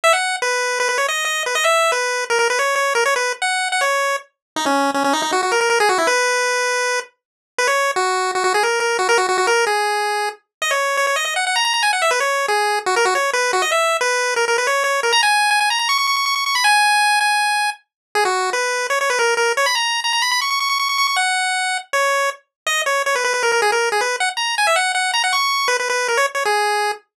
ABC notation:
X:1
M:4/4
L:1/16
Q:1/4=159
K:B
V:1 name="Lead 1 (square)"
e f3 B4 B B c d2 d2 B | d e3 B4 A A B c2 c2 A | c B2 z f3 f c4 z4 | D C3 C C D D F F A A A G F E |
B12 z4 | B c3 F4 F F G A2 A2 F | A F F F A2 G8 z2 | d c3 c c d d f f a a a g f e |
B c3 G4 F A F c2 B2 F | d e3 B4 A A B c2 c2 A | a g3 g g a a c' c' c' c' c' c' c' b | g6 g6 z4 |
G F3 B4 c c B A2 A2 c | b a3 a a b b c' c' c' c' c' c' c' c' | f8 c4 z4 | [K:G#m] d2 c2 c B B B A A G A2 G B2 |
f z a2 g e f2 f2 a f c'4 | B B B2 A c z c G6 z2 |]